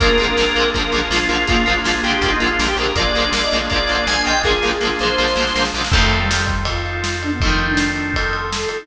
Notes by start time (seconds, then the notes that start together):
0.00 A#1 G#3 A#3 D4 F4 G#4 A#4, kick, closed hi-hat
0.04 D3 F3
0.17 A#1 A#3 C4, closed hi-hat
0.21 D3 F3 G#3
0.37 A#1 F3 G#3 A#3, snare
0.42 D3
0.55 A#1 G#3 A#3 C4, closed hi-hat
0.60 D3 F3
0.74 A#1 F3 G#3 A#3 A#4, kick, closed hi-hat
0.80 D3
0.92 A#1 F3 G#3 A#3, closed hi-hat
0.96 D3 F3
1.10 A#1 G#3 A#3 F4, snare
1.15 D3 F3
1.29 A#1 F3 G#3 A#3 F4, closed hi-hat
1.34 D3
1.47 A#1 G#3 A#3 F4, kick, closed hi-hat
1.52 D3 F3
1.66 A#1 F3 G#3 A#3, closed hi-hat
1.72 D3
1.84 A#1 F3 G#3 A#3 F4, snare
1.90 D3
1.94 A#3
2.03 A#1 G#3 A#3 G4, closed hi-hat
2.08 D3 F3
2.13 G4
2.21 A#1 G#3 A#3 F4 G4, kick, closed hi-hat
2.26 D3 F3
2.32 D#4
2.40 A#1 F3 G#3 A#3 F4, closed hi-hat
2.46 D3
2.59 A#1 G#3 A#3, snare
2.64 D3 F3
2.68 G4
2.76 A#1 G#3 A#3 G4 A#4, closed hi-hat
2.82 D3 F3
2.95 A#1 G#3 A#3 D4 F4 G#4 D5, kick, closed hi-hat
2.99 D3 F3
3.15 A#1 G#3 A#3, closed hi-hat
3.20 D3 F3
3.32 A#1 G#3 A#3, snare
3.37 D3 F3
3.43 D#5
3.51 A#1 G#3 A#3, closed hi-hat
3.56 D3 F3
3.70 A#1 G#3 A#3 D5, kick, closed hi-hat
3.74 D3 F3
3.87 A#1 G#3 A#3, closed hi-hat
3.93 D3 F3
4.07 A#1 G#3 A#3 G#5, snare
4.11 D3 F3
4.25 A#1 F3 G#3 A#3 D#5 G5, closed hi-hat
4.30 D3
4.43 A#1 G#3 A#3 F4 G#4, kick, snare
4.48 D3 F3
4.62 A#1 G#3 A#3, snare
4.67 D3 F3
4.81 A#1 G#3 A#3, snare
4.85 D3 F3
4.99 A#1 G#3 A#3 C5, snare
5.05 D3 F3
5.18 A#1 F3 G#3 A#3, snare
5.24 D3, snare
5.36 A#1 G#3 A#3, snare
5.40 D3 F3
5.47 snare
5.55 A#1 G#3 A#3, snare
5.59 D3 F3
5.65 snare
5.74 A#1 G#3 A#3, snare
5.78 D3 F3
5.84 snare
5.92 F2 F3 A3 C4 D#4 F4 A4, kick, crash
5.97 D#3
6.11 ride
6.20 G3
6.31 snare
6.47 kick, ride
6.65 F4, kick, ride
6.86 ride
7.04 snare
7.22 D4, ride
7.31 B3
7.41 A3 C4 D#4, kick, ride
7.45 D#3 F3
7.59 ride
7.69 D4
7.77 snare
7.96 ride
8.14 A4, kick, ride
8.33 ride
8.52 snare
8.69 A4, ride
8.79 D#4